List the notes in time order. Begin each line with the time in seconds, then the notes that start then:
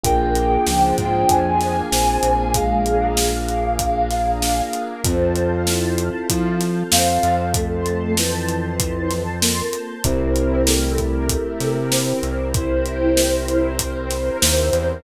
0.04 A#1 A#3 D4 F4 G#4 G5, kick, closed hi-hat
0.35 closed hi-hat
0.67 C#2 F3, snare
0.98 G#2, kick, closed hi-hat
1.29 F2 G#5, kick, closed hi-hat
1.61 snare, closed hi-hat
1.91 A#1 C4, snare
2.23 A#1, closed hi-hat
2.54 G#3 A#3 D4 G#4 A#4 F5, kick, closed hi-hat
2.86 closed hi-hat
3.17 snare
3.48 closed hi-hat
3.79 kick, closed hi-hat
4.11 snare, closed hi-hat
4.42 snare
4.73 closed hi-hat
5.04 F2 C4 F4 A4 C5 F5 A5, kick, closed hi-hat
5.36 closed hi-hat
5.67 E4, snare
5.98 closed hi-hat
6.30 F3, kick, closed hi-hat
6.60 snare, closed hi-hat
6.92 F2 C4 F5, snare
7.23 F2, closed hi-hat
7.54 A3 C5 A5 C6, kick, closed hi-hat
7.86 closed hi-hat
8.17 E3, snare
8.48 closed hi-hat
8.80 kick, closed hi-hat
9.11 snare, closed hi-hat
9.41 A#3, snare
9.73 closed hi-hat
10.04 C2 C4 E4 G4 A#4, kick, closed hi-hat
10.36 closed hi-hat
10.66 A3, snare
10.98 kick, closed hi-hat
11.29 kick, closed hi-hat
11.60 C3, snare, closed hi-hat
11.91 C4, snare
12.23 C2, closed hi-hat
12.54 C4 E4 A#4 C5, kick, closed hi-hat
12.86 closed hi-hat
13.17 snare
13.48 closed hi-hat
13.79 kick, closed hi-hat
14.10 snare, closed hi-hat
14.42 D#2, snare
14.73 E2, closed hi-hat